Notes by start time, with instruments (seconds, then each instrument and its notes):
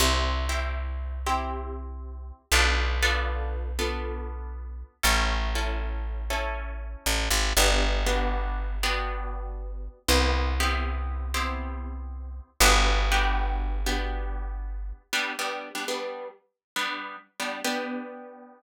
0.00 electric bass (finger) C2, acoustic guitar (steel) C4 E4 G4
0.49 acoustic guitar (steel) C4 E4 G4
1.26 acoustic guitar (steel) C4 E4 G4
2.52 electric bass (finger) B1, acoustic guitar (steel) B3 D4 F4 A4
3.03 acoustic guitar (steel) B3 D4 F4 A4
3.79 acoustic guitar (steel) B3 D4 F4 A4
5.03 electric bass (finger) A1, acoustic guitar (steel) C#4 E4 A4
5.55 acoustic guitar (steel) C#4 E4 A4
6.30 acoustic guitar (steel) C#4 E4 A4
7.06 electric bass (finger) A1
7.30 electric bass (finger) G#1
7.57 electric bass (finger) G1, acoustic guitar (steel) B3 D4 F#4 G4
8.06 acoustic guitar (steel) B3 D4 F#4 G4
8.83 acoustic guitar (steel) B3 D4 F#4 G4
10.08 electric bass (finger) C2, acoustic guitar (steel) B3 C4 E4 G4
10.60 acoustic guitar (steel) B3 C4 E4 G4
11.34 acoustic guitar (steel) B3 C4 E4 G4
12.60 electric bass (finger) G1, acoustic guitar (steel) B3 D4 F#4 G4
13.12 acoustic guitar (steel) B3 D4 F#4 G4
13.86 acoustic guitar (steel) B3 D4 F#4 G4
15.13 acoustic guitar (steel) G3 B3 D4
15.39 acoustic guitar (steel) G3 B3 D4
15.75 acoustic guitar (steel) G3 B3 D4
15.88 acoustic guitar (steel) G3 B3 D4
16.76 acoustic guitar (steel) G3 B3 D4
17.40 acoustic guitar (steel) G3 B3 D4
17.64 acoustic guitar (steel) B3 D4 G4